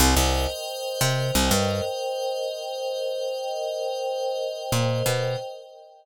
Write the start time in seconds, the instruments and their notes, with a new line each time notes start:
0.00 electric bass (finger) C2, pad 5 (bowed) A#4 C5 D#5 G5
0.16 electric bass (finger) C2
1.01 electric bass (finger) C3
1.35 electric bass (finger) C2
1.51 electric bass (finger) G2
4.72 electric bass (finger) A#2
5.06 electric bass (finger) B2